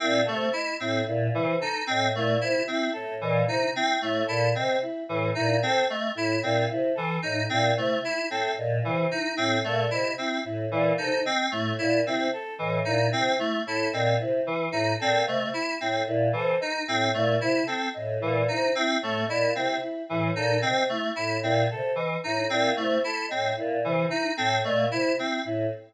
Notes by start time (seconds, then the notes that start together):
0.00 A#2 C4 E4
0.25 C3 A3 A4
0.53 E4 D#5
0.80 A2 C4 E4
1.06 A#2 E4
1.33 C3 E3 E4
1.60 D#4 A4
1.87 A2 C4 D#5
2.14 A#2 A3 E4
2.41 C3 E4
2.67 C4 E4
2.93 A2 A4
3.21 A#2 E3 D#5
3.47 C3 D#4 E4
3.76 C4 E4
4.02 A2 A3 E4
4.27 A#2 E4 A4
4.55 C3 C4 D#5
4.82 E4
5.08 A2 E3 E4
5.35 A#2 D#4 E4
5.62 C3 C4 A4
5.89 A3 D#5
6.15 A2 E4
6.43 A#2 C4 E4
6.69 C3 E4
6.95 E3 A4
7.22 A2 D#4 D#5
7.49 A#2 C4 E4
7.76 C3 A3 E4
8.03 E4
8.30 A2 C4 A4
8.58 A#2 D#5
8.83 C3 E3 E4
9.10 D#4 E4
9.36 A2 C4 E4
9.64 A#2 A3 A4
9.91 C3 E4 D#5
10.18 C4 E4
10.44 A2 E4
10.71 A#2 E3 E4
10.98 C3 D#4 A4
11.24 C4 D#5
11.51 A2 A3 E4
11.78 A#2 E4
12.05 C3 C4 E4
12.33 A4
12.59 A2 E3 D#5
12.85 A#2 D#4 E4
13.11 C3 C4 E4
13.38 A3 E4
13.66 A2 E4 A4
13.93 A#2 C4 D#5
14.19 C3 E4
14.45 E3 E4
14.72 A2 D#4 E4
14.99 A#2 C4 A4
15.26 C3 A3 D#5
15.53 E4
15.80 A2 C4 E4
16.07 A#2 E4
16.33 C3 E3 A4
16.60 D#4 D#5
16.87 A2 C4 E4
17.14 A#2 A3 E4
17.41 C3 E4
17.66 C4 A4
17.94 A2 D#5
18.20 A#2 E3 E4
18.48 C3 D#4 E4
18.75 C4 E4
19.02 A2 A3 A4
19.27 A#2 E4 D#5
19.55 C3 C4 E4
19.81 E4
20.09 A2 E3 E4
20.35 A#2 D#4 A4
20.62 C3 C4 D#5
20.89 A3 E4
21.16 A2 E4
21.42 A#2 C4 E4
21.70 C3 A4
21.95 E3 D#5
22.24 A2 D#4 E4
22.50 A#2 C4 E4
22.76 C3 A3 E4
23.04 E4 A4
23.28 A2 C4 D#5
23.56 A#2 E4
23.83 C3 E3 E4
24.09 D#4 E4
24.37 A2 C4 A4
24.64 A#2 A3 D#5
24.91 C3 E4
25.18 C4 E4
25.45 A2 E4